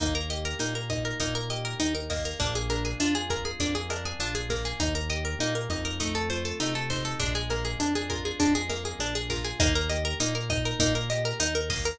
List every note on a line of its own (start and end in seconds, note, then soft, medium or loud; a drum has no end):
0.00 0.54 D#2 medium
0.00 0.59 A#3 medium
0.00 0.14 D#4 medium
0.00 kick loud
0.00 cross-stick loud
0.00 closed hi-hat loud
0.15 0.29 A#4 medium
0.30 1.50 G4 medium
0.30 0.44 D#5 medium
0.30 closed hi-hat medium
0.45 0.59 A#4 medium
0.59 1.14 A#2 medium
0.59 1.20 A#3 medium
0.59 0.74 D#4 medium
0.59 closed hi-hat loud
0.75 0.89 A#4 medium
0.90 1.79 D#4 medium
0.90 1.04 D#5 medium
0.90 kick medium
0.90 cross-stick medium
0.90 closed hi-hat medium
1.05 1.19 A#4 medium
1.20 1.75 A#2 medium
1.20 2.10 A#3 medium
1.20 1.34 D#4 medium
1.20 kick medium
1.20 closed hi-hat loud
1.35 1.49 A#4 medium
1.50 2.35 G4 medium
1.50 1.64 D#5 medium
1.50 closed hi-hat medium
1.65 1.79 A#4 medium
1.80 2.34 D#2 medium
1.80 1.94 D#4 medium
1.80 2.37 D#4 medium
1.80 cross-stick medium
1.80 closed hi-hat loud
1.95 2.08 A#4 medium
2.10 2.39 A#3 medium
2.10 2.24 D#5 medium
2.10 kick medium
2.10 snare medium
2.10 open hi-hat medium
2.25 2.39 A#4 medium
2.40 2.94 A#1 medium
2.40 3.60 A#3 medium
2.40 2.54 D4 medium
2.40 kick loud
2.40 closed hi-hat loud
2.55 2.69 G#4 medium
2.70 3.90 D4 medium
2.70 2.84 A#4 medium
2.70 closed hi-hat medium
2.85 2.99 G#4 medium
3.00 3.54 F2 medium
3.00 3.14 D4 medium
3.00 4.20 F4 medium
3.00 cross-stick loud
3.00 closed hi-hat loud
3.15 3.29 G#4 medium
3.30 4.72 G#4 medium
3.30 3.44 A#4 medium
3.30 kick medium
3.30 closed hi-hat medium
3.45 3.59 G#4 medium
3.60 4.13 F2 medium
3.60 4.50 A#3 medium
3.60 3.74 D4 medium
3.60 kick medium
3.60 closed hi-hat loud
3.75 3.89 G#4 medium
3.90 4.75 D4 medium
3.90 4.04 A#4 medium
3.90 cross-stick loud
3.90 closed hi-hat medium
4.05 4.19 G#4 medium
4.19 4.73 A#1 medium
4.19 4.34 D4 medium
4.19 4.77 F4 medium
4.19 closed hi-hat medium
4.35 4.49 G#4 medium
4.50 5.40 A#3 medium
4.50 4.64 A#4 medium
4.50 kick medium
4.50 snare medium
4.50 closed hi-hat medium
4.65 4.79 G#4 medium
4.80 5.35 D#2 medium
4.80 4.94 D#4 medium
4.80 kick medium
4.80 cross-stick loud
4.80 closed hi-hat loud
4.95 5.09 A#4 medium
5.09 5.95 G4 medium
5.09 5.24 D#5 medium
5.09 closed hi-hat medium
5.25 5.39 A#4 medium
5.39 5.67 A#2 medium
5.39 5.98 A#3 medium
5.39 5.54 D#4 medium
5.39 closed hi-hat loud
5.55 5.69 A#4 medium
5.69 6.53 F2 medium
5.69 5.98 D#4 medium
5.69 5.84 D#5 medium
5.69 kick medium
5.69 cross-stick medium
5.69 closed hi-hat medium
5.85 5.99 A#4 medium
6.00 6.60 A3 medium
6.00 6.14 D#4 medium
6.00 kick medium
6.00 closed hi-hat loud
6.15 6.29 A4 medium
6.30 7.16 F4 medium
6.30 6.44 C5 medium
6.30 closed hi-hat medium
6.45 6.59 A4 medium
6.60 7.14 C3 medium
6.60 7.17 A3 medium
6.60 6.74 D#4 medium
6.60 cross-stick medium
6.60 closed hi-hat loud
6.75 6.89 A4 medium
6.90 7.19 D#4 medium
6.90 7.04 C5 medium
6.90 kick medium
6.90 snare medium
6.90 closed hi-hat medium
7.05 7.19 A4 medium
7.20 7.75 A#1 medium
7.20 8.40 G#3 medium
7.20 7.33 D4 medium
7.20 kick loud
7.20 closed hi-hat loud
7.35 7.49 G#4 medium
7.50 8.69 A#3 medium
7.50 7.64 A#4 medium
7.50 closed hi-hat medium
7.65 7.79 G#4 medium
7.79 8.33 F2 medium
7.79 7.94 D4 medium
7.79 9.00 D4 medium
7.79 cross-stick medium
7.79 closed hi-hat loud
7.95 8.09 G#4 medium
8.10 9.30 F4 medium
8.10 8.23 A#4 medium
8.10 kick medium
8.10 closed hi-hat medium
8.25 8.39 G#4 medium
8.40 8.94 F2 medium
8.40 9.54 G#3 medium
8.40 8.54 D4 medium
8.40 kick medium
8.40 closed hi-hat loud
8.55 8.69 G#4 medium
8.70 9.55 A#3 medium
8.70 8.83 A#4 medium
8.70 cross-stick medium
8.70 closed hi-hat medium
8.85 8.99 G#4 medium
8.99 9.53 A#1 medium
8.99 9.14 D4 medium
8.99 9.57 D4 medium
8.99 closed hi-hat loud
9.15 9.29 G#4 medium
9.30 9.59 F4 medium
9.30 9.44 A#4 medium
9.30 kick medium
9.30 snare medium
9.30 closed hi-hat medium
9.45 9.58 G#4 medium
9.60 10.14 D#2 medium
9.60 9.91 A#3 loud
9.60 9.74 D#4 medium
9.60 kick loud
9.60 cross-stick loud
9.60 closed hi-hat loud
9.75 9.89 A#4 medium
9.89 10.20 G4 medium
9.89 10.03 D#5 medium
9.89 closed hi-hat medium
10.05 10.19 A#4 medium
10.20 10.74 A#2 medium
10.20 10.50 A#3 medium
10.20 10.34 D#4 medium
10.20 closed hi-hat loud
10.35 10.49 A#4 medium
10.50 10.80 D#4 medium
10.50 10.64 D#5 medium
10.50 kick loud
10.50 cross-stick loud
10.50 closed hi-hat medium
10.65 10.79 A#4 medium
10.79 11.33 A#2 medium
10.79 11.10 A#3 medium
10.79 10.94 D#4 medium
10.79 kick loud
10.79 closed hi-hat loud
10.95 11.09 A#4 medium
11.10 11.41 G4 medium
11.10 11.24 D#5 medium
11.10 closed hi-hat medium
11.25 11.39 A#4 medium
11.39 11.94 D#2 medium
11.39 11.70 D#4 medium
11.39 11.54 D#4 medium
11.39 cross-stick loud
11.39 closed hi-hat loud
11.55 11.69 A#4 medium
11.70 11.98 A#3 medium
11.70 11.84 D#5 medium
11.70 kick loud
11.70 snare medium
11.70 open hi-hat medium
11.85 11.99 A#4 medium